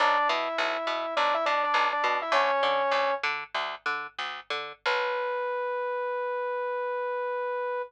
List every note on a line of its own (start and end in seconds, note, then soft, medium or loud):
0.00 0.18 B1 loud
0.00 0.28 D4 loud
0.00 0.28 D5 loud
0.29 0.48 B2 loud
0.29 1.14 E4 medium
0.29 1.14 E5 medium
0.58 0.77 B1 loud
0.87 1.06 B2 medium
1.17 1.36 B1 medium
1.17 1.34 D4 medium
1.17 1.34 D5 loud
1.34 1.45 E4 medium
1.34 1.45 E5 loud
1.46 1.65 B2 medium
1.46 1.63 D4 medium
1.46 1.63 D5 medium
1.64 1.87 D4 medium
1.64 1.87 D5 medium
1.74 1.93 B1 medium
1.93 2.17 D4 medium
1.93 2.17 D5 medium
2.04 2.23 B2 medium
2.22 2.32 E4 medium
2.22 2.32 E5 medium
2.32 2.51 D2 loud
2.32 3.14 C#4 loud
2.32 3.14 C#5 loud
2.63 2.83 D3 medium
2.91 3.11 D2 medium
3.23 3.44 D3 loud
3.54 3.75 D2 medium
3.86 4.07 D3 medium
4.19 4.40 D2 medium
4.50 4.73 D3 medium
4.85 7.81 B1 loud
4.85 7.82 B4 loud